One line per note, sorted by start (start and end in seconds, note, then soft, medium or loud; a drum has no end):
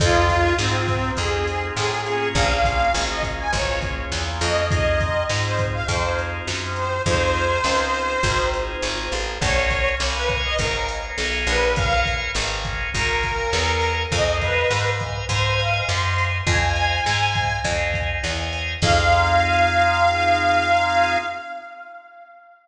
0.00 0.53 F2 loud
0.00 0.53 C4 medium
0.00 0.53 D#4 medium
0.00 0.53 F4 medium
0.00 0.55 F4 medium
0.00 0.53 G#4 medium
0.00 kick loud
0.00 closed hi-hat loud
0.30 kick medium
0.30 closed hi-hat medium
0.58 1.12 G#2 medium
0.58 1.12 C4 medium
0.58 1.13 C4 medium
0.58 1.13 D#4 medium
0.58 1.13 F4 medium
0.58 1.13 G#4 medium
0.58 snare loud
0.88 kick medium
0.88 closed hi-hat medium
1.17 1.71 F2 medium
1.17 2.01 C4 medium
1.17 2.01 D#4 medium
1.17 2.01 F4 medium
1.17 2.01 G#4 medium
1.17 1.66 G#4 medium
1.17 kick medium
1.17 closed hi-hat medium
1.47 closed hi-hat medium
1.76 2.29 A2 medium
1.76 2.29 G#4 medium
1.76 snare loud
2.06 2.89 A#3 medium
2.06 2.89 C#4 medium
2.06 2.89 F4 medium
2.06 2.89 G#4 medium
2.06 closed hi-hat medium
2.35 2.88 A#1 loud
2.35 2.93 F5 medium
2.35 kick loud
2.35 closed hi-hat medium
2.64 kick medium
2.64 closed hi-hat medium
2.94 3.47 G#1 loud
2.94 3.48 A#3 medium
2.94 3.48 C#4 medium
2.94 3.48 F4 medium
2.94 3.48 G#4 medium
2.94 snare loud
3.09 3.23 D#5 medium
3.23 kick medium
3.23 closed hi-hat medium
3.38 3.52 G#5 medium
3.53 4.06 G#1 loud
3.53 4.61 A#3 medium
3.53 4.61 C#4 medium
3.53 4.61 F4 medium
3.53 4.61 G#4 medium
3.53 3.79 C#5 medium
3.53 kick medium
3.53 closed hi-hat medium
3.81 kick medium
3.81 closed hi-hat medium
4.12 4.40 E2 medium
4.12 snare loud
4.41 5.23 F2 loud
4.41 4.68 D#5 medium
4.41 open hi-hat medium
4.71 5.25 C4 medium
4.71 5.25 D#4 medium
4.71 5.25 F4 medium
4.71 5.25 G#4 medium
4.71 5.24 D#5 medium
4.71 kick loud
4.71 closed hi-hat loud
5.00 kick medium
5.00 closed hi-hat medium
5.29 5.83 G#2 medium
5.29 5.83 C4 medium
5.29 5.83 D#4 medium
5.29 5.83 F4 medium
5.29 5.83 G#4 medium
5.29 snare loud
5.44 5.58 C5 medium
5.59 kick medium
5.59 closed hi-hat medium
5.74 5.87 F5 medium
5.88 6.41 F2 loud
5.88 6.97 C4 medium
5.88 6.97 D#4 medium
5.88 6.97 F4 medium
5.88 6.97 G#4 medium
5.88 6.16 C5 medium
5.88 kick medium
5.88 closed hi-hat medium
6.19 closed hi-hat medium
6.47 7.00 F#2 medium
6.47 snare loud
6.76 7.02 C5 medium
6.76 closed hi-hat medium
7.06 7.59 F2 loud
7.06 7.61 C4 medium
7.06 7.61 D#4 medium
7.06 7.61 F4 medium
7.06 7.61 G#4 medium
7.06 8.47 C5 medium
7.06 kick medium
7.06 closed hi-hat loud
7.35 closed hi-hat medium
7.64 8.17 C#2 medium
7.64 8.19 C4 medium
7.64 8.19 D#4 medium
7.64 8.19 F4 medium
7.64 8.19 G#4 medium
7.64 snare loud
7.94 closed hi-hat medium
8.23 8.76 G#1 loud
8.23 9.31 C4 medium
8.23 9.31 D#4 medium
8.23 9.31 F4 medium
8.23 9.31 G#4 medium
8.23 kick medium
8.23 closed hi-hat loud
8.54 closed hi-hat medium
8.82 9.09 G#1 medium
8.82 snare medium
9.12 9.38 A1 medium
9.12 closed hi-hat medium
9.41 9.94 A#1 loud
9.41 9.95 A#4 medium
9.41 9.95 C#5 medium
9.41 9.89 C#5 medium
9.41 9.95 F5 medium
9.41 9.95 G#5 medium
9.41 kick loud
9.41 closed hi-hat loud
9.70 kick medium
9.70 closed hi-hat medium
10.00 10.53 C2 medium
10.00 10.54 A#4 medium
10.00 10.54 C#5 medium
10.00 10.54 F5 medium
10.00 10.54 G#5 medium
10.00 snare loud
10.15 10.29 B4 medium
10.29 kick medium
10.29 closed hi-hat medium
10.44 10.58 D#5 medium
10.58 11.12 G#1 medium
10.58 10.86 A#4 medium
10.58 11.68 A#4 medium
10.58 11.68 C#5 medium
10.58 11.68 F5 medium
10.58 11.68 G#5 medium
10.58 kick medium
10.58 closed hi-hat medium
10.88 closed hi-hat medium
11.18 11.46 B1 medium
11.18 snare loud
11.47 12.29 A#1 loud
11.47 11.75 B4 medium
11.47 closed hi-hat medium
11.76 12.31 A#4 medium
11.76 12.31 C#5 medium
11.76 12.00 F5 medium
11.76 12.31 F5 medium
11.76 12.31 G#5 medium
11.76 kick loud
11.76 closed hi-hat loud
12.06 kick medium
12.06 closed hi-hat medium
12.35 12.88 G#1 loud
12.35 12.90 A#4 medium
12.35 12.90 C#5 medium
12.35 12.90 F5 medium
12.35 12.90 G#5 medium
12.35 snare loud
12.65 kick medium
12.65 closed hi-hat medium
12.94 13.47 G#1 medium
12.94 13.95 A#4 medium
12.94 14.03 A#4 medium
12.94 14.03 C#5 medium
12.94 14.03 F5 medium
12.94 14.03 G#5 medium
12.94 kick medium
12.94 closed hi-hat medium
13.23 kick medium
13.23 closed hi-hat medium
13.53 14.06 E2 loud
13.53 snare loud
13.81 closed hi-hat medium
14.12 14.65 F2 loud
14.12 14.66 C5 medium
14.12 14.37 D#5 medium
14.12 14.66 D#5 medium
14.12 14.66 F5 medium
14.12 14.66 G#5 medium
14.12 kick loud
14.12 closed hi-hat loud
14.41 14.90 B4 medium
14.41 kick medium
14.41 closed hi-hat medium
14.70 15.23 G#2 medium
14.70 15.25 C5 medium
14.70 15.25 D#5 medium
14.70 15.25 F5 medium
14.70 15.25 G#5 medium
14.70 snare loud
15.00 kick medium
15.00 closed hi-hat medium
15.29 15.82 G#2 loud
15.29 16.37 C5 medium
15.29 15.55 C5 medium
15.29 16.37 D#5 medium
15.29 16.37 F5 medium
15.29 16.37 G#5 medium
15.29 kick medium
15.29 closed hi-hat loud
15.59 15.85 F5 medium
15.59 closed hi-hat medium
15.88 16.42 F#2 loud
15.88 16.25 C6 medium
15.88 snare medium
16.18 closed hi-hat medium
16.47 17.00 F2 loud
16.47 17.01 C5 medium
16.47 17.01 D#5 medium
16.47 17.01 F5 medium
16.47 17.01 G#5 medium
16.47 17.59 G#5 medium
16.47 kick loud
16.47 closed hi-hat medium
16.75 closed hi-hat medium
17.06 17.59 G#2 medium
17.06 17.60 C5 medium
17.06 17.60 D#5 medium
17.06 17.60 F5 medium
17.06 17.60 G#5 medium
17.06 snare loud
17.35 kick medium
17.35 closed hi-hat medium
17.64 18.18 F2 loud
17.64 18.74 C5 medium
17.64 18.74 D#5 medium
17.64 18.74 F5 medium
17.64 18.74 G#5 medium
17.64 kick medium
17.64 closed hi-hat loud
17.94 kick medium
17.94 closed hi-hat medium
18.24 18.76 E2 medium
18.24 snare medium
18.53 closed hi-hat medium
18.82 21.17 F2 loud
18.82 21.18 C4 loud
18.82 21.18 D#4 loud
18.82 21.18 F4 medium
18.82 21.18 G#4 medium
18.82 21.17 F5 loud
18.82 kick loud
18.82 crash loud